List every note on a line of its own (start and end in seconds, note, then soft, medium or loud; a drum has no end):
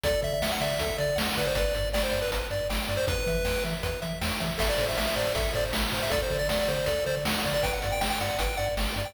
0.03 0.14 D2 medium
0.03 0.21 A4 loud
0.03 0.21 D5 medium
0.03 kick loud
0.03 closed hi-hat loud
0.22 0.33 D3 medium
0.22 0.39 D5 medium
0.22 0.33 E5 medium
0.22 kick medium
0.22 closed hi-hat medium
0.34 0.42 E5 medium
0.42 0.52 D2 medium
0.42 0.52 E5 medium
0.42 0.59 F#5 medium
0.42 snare loud
0.52 0.61 F#5 medium
0.61 0.71 D3 medium
0.61 0.78 D5 medium
0.61 0.97 E5 medium
0.61 closed hi-hat medium
0.79 0.90 D2 medium
0.79 0.98 A4 loud
0.79 kick loud
0.79 closed hi-hat loud
0.98 1.09 D3 medium
0.98 1.15 D5 medium
0.98 1.18 D5 medium
0.98 closed hi-hat medium
1.16 1.28 D2 medium
1.16 1.33 F#5 loud
1.16 snare loud
1.36 1.47 D3 medium
1.36 1.46 B4 medium
1.36 1.54 D5 medium
1.36 kick medium
1.36 closed hi-hat medium
1.46 1.55 C5 medium
1.55 1.66 G1 medium
1.55 1.75 B4 loud
1.55 1.89 D5 medium
1.55 kick loud
1.55 closed hi-hat loud
1.73 1.85 G2 medium
1.73 1.90 D5 medium
1.73 kick medium
1.73 closed hi-hat medium
1.93 2.04 G1 medium
1.93 2.02 D5 medium
1.93 2.11 G5 medium
1.93 snare loud
2.03 2.20 C5 medium
2.11 2.23 G2 medium
2.11 2.28 D5 medium
2.11 closed hi-hat medium
2.22 2.31 B4 medium
2.30 2.42 G1 medium
2.30 2.47 B4 medium
2.30 kick medium
2.30 closed hi-hat loud
2.51 2.61 G2 medium
2.51 2.68 D5 loud
2.51 closed hi-hat medium
2.69 2.80 G1 medium
2.69 2.86 G5 medium
2.69 snare loud
2.88 2.99 G2 medium
2.88 3.06 D5 medium
2.88 closed hi-hat medium
2.97 3.06 C5 medium
3.07 3.18 E2 medium
3.07 3.24 B4 loud
3.07 3.64 B4 medium
3.07 kick loud
3.07 closed hi-hat loud
3.27 3.37 E3 medium
3.27 3.45 E5 medium
3.27 kick medium
3.27 closed hi-hat medium
3.45 3.56 E2 medium
3.45 3.62 G5 medium
3.45 snare loud
3.64 3.75 E3 medium
3.64 3.82 E5 medium
3.64 closed hi-hat medium
3.83 3.94 E2 medium
3.83 4.00 B4 loud
3.83 kick medium
3.83 closed hi-hat loud
4.02 4.13 E3 medium
4.02 4.19 E5 loud
4.02 closed hi-hat medium
4.21 4.32 E2 medium
4.21 4.38 G5 medium
4.21 snare loud
4.40 4.51 E3 medium
4.40 4.57 E5 medium
4.40 kick medium
4.40 closed hi-hat medium
4.58 4.70 A1 medium
4.58 4.75 A4 loud
4.58 4.69 E5 medium
4.58 kick loud
4.58 crash loud
4.69 4.86 D5 medium
4.78 4.89 A2 medium
4.78 4.97 C5 medium
4.78 kick loud
4.78 closed hi-hat medium
4.89 4.97 E5 medium
4.97 5.08 A1 medium
4.97 5.14 E5 medium
4.97 5.06 E5 medium
4.97 snare loud
5.07 5.16 E5 medium
5.16 5.27 A2 medium
5.16 5.33 C5 loud
5.16 5.33 D5 medium
5.16 closed hi-hat medium
5.35 5.46 A1 medium
5.35 5.52 A4 loud
5.35 5.53 E5 medium
5.35 kick loud
5.35 closed hi-hat loud
5.54 5.65 A2 medium
5.54 5.71 C5 loud
5.54 5.64 D5 medium
5.54 closed hi-hat medium
5.72 5.84 A1 medium
5.72 5.89 E5 medium
5.72 snare loud
5.92 6.03 A2 medium
5.92 6.09 C5 medium
5.92 kick medium
5.92 open hi-hat medium
6.03 6.12 E5 medium
6.10 6.22 D2 medium
6.10 6.27 A4 loud
6.10 6.21 D5 medium
6.10 kick loud
6.10 closed hi-hat loud
6.22 6.38 C5 medium
6.30 6.41 D3 medium
6.30 6.49 D5 medium
6.30 kick medium
6.30 closed hi-hat medium
6.39 6.48 D5 medium
6.49 6.60 D2 medium
6.49 6.59 D5 medium
6.49 6.66 F#5 medium
6.49 snare loud
6.59 6.68 D5 medium
6.68 6.79 D3 medium
6.68 6.86 C5 medium
6.68 6.85 D5 medium
6.68 closed hi-hat medium
6.86 6.98 D2 medium
6.86 7.04 A4 loud
6.86 7.04 D5 medium
6.86 kick loud
6.86 closed hi-hat loud
7.06 7.17 D3 medium
7.06 7.15 C5 medium
7.06 7.24 D5 medium
7.06 closed hi-hat medium
7.25 7.36 D2 medium
7.25 7.44 F#5 loud
7.25 snare loud
7.44 7.55 D3 medium
7.44 7.62 D5 medium
7.44 kick medium
7.44 closed hi-hat medium
7.54 7.63 D5 medium
7.63 7.74 G1 medium
7.63 7.80 B4 loud
7.63 7.72 G5 medium
7.63 kick loud
7.63 closed hi-hat loud
7.73 7.92 F#5 medium
7.82 7.93 G2 medium
7.82 8.00 D5 medium
7.82 kick medium
7.82 closed hi-hat medium
7.92 8.01 G5 medium
8.01 8.12 G1 medium
8.01 8.10 G5 medium
8.01 8.18 G5 medium
8.01 snare loud
8.10 8.19 G5 medium
8.20 8.31 G2 medium
8.20 8.38 D5 medium
8.20 8.38 F#5 medium
8.20 closed hi-hat medium
8.39 8.50 G1 medium
8.39 8.56 B4 medium
8.39 8.58 G5 medium
8.39 kick medium
8.39 closed hi-hat loud
8.57 8.69 G2 medium
8.57 8.75 D5 loud
8.57 8.66 F#5 medium
8.57 closed hi-hat medium
8.77 8.88 G1 medium
8.77 8.94 G5 medium
8.77 snare loud
8.96 9.06 G2 medium
8.96 9.14 D5 medium
8.96 closed hi-hat medium
9.05 9.14 G5 medium